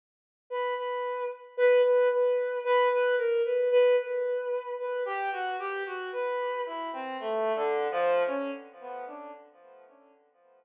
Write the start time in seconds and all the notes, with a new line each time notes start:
0.50 B4
0.77 B4
1.57 B4
1.84 B4
2.11 B4
2.64 B4
2.91 B4
3.18 A#4
3.45 B4
3.71 B4
3.98 B4
4.79 B4
5.05 G4
5.32 F#4
5.59 G4
5.86 F#4
6.13 B4
6.66 E4
6.93 C4
7.20 A3
7.55 D3
7.91 F3
8.27 C#4
8.80 B3
9.07 D4